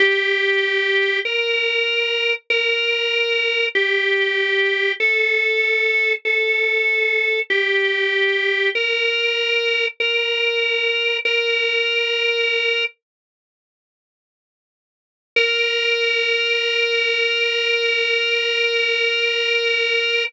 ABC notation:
X:1
M:3/4
L:1/8
Q:1/4=48
K:Bb
V:1 name="Drawbar Organ"
G2 B2 B2 | G2 A2 A2 | G2 B2 B2 | "^rit." B3 z3 |
B6 |]